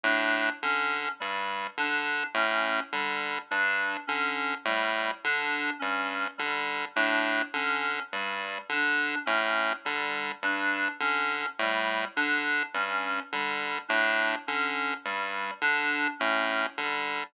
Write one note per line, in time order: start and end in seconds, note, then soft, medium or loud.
0.04 0.50 A2 medium
0.04 0.50 D4 medium
0.62 1.09 D3 medium
0.62 1.09 C#4 medium
1.20 1.67 G2 medium
1.20 1.66 G3 medium
1.77 2.24 D3 medium
1.77 2.25 D4 medium
2.34 2.80 A2 medium
2.34 2.81 C#4 medium
2.93 3.39 D3 medium
2.93 3.39 G3 medium
3.51 3.97 G2 medium
3.51 3.97 D4 medium
4.07 4.55 D3 medium
4.07 4.53 C#4 medium
4.65 5.11 A2 medium
4.65 5.12 G3 medium
5.24 5.70 D3 medium
5.24 5.71 D4 medium
5.79 6.28 G2 medium
5.79 6.25 C#4 medium
6.38 6.85 D3 medium
6.38 6.84 G3 medium
6.96 7.42 A2 medium
6.96 7.42 D4 medium
7.54 8.00 D3 medium
7.54 8.01 C#4 medium
8.12 8.59 G2 medium
8.12 8.59 G3 medium
8.69 9.15 D3 medium
8.69 9.18 D4 medium
9.26 9.73 A2 medium
9.26 9.72 C#4 medium
9.85 10.32 D3 medium
9.85 10.31 G3 medium
10.42 10.88 G2 medium
10.42 10.89 D4 medium
11.00 11.46 D3 medium
11.00 11.47 C#4 medium
11.59 12.05 A2 medium
11.59 12.06 G3 medium
12.16 12.63 D3 medium
12.16 12.62 D4 medium
12.74 13.20 G2 medium
12.74 13.21 C#4 medium
13.32 13.79 D3 medium
13.32 13.79 G3 medium
13.89 14.36 A2 medium
13.89 14.35 D4 medium
14.47 14.94 D3 medium
14.47 14.94 C#4 medium
15.05 15.51 G2 medium
15.05 15.52 G3 medium
15.62 16.08 D3 medium
15.62 16.08 D4 medium
16.19 16.67 A2 medium
16.19 16.66 C#4 medium
16.78 17.24 D3 medium
16.78 17.24 G3 medium